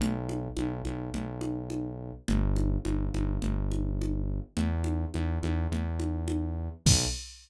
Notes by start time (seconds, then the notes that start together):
0.00 B1, low conga
0.29 high conga
0.57 B1, high conga
0.85 B1, high conga
1.14 B1, low conga
1.41 high conga
1.70 high conga
2.28 G1, low conga
2.56 high conga
2.85 G1, high conga
3.14 G1, high conga
3.42 G1, low conga
3.72 high conga
4.02 high conga
4.57 E2, low conga
4.84 high conga
5.14 E2, high conga
5.43 E2, high conga
5.72 E2, low conga
6.00 high conga
6.28 high conga
6.86 B1, kick, crash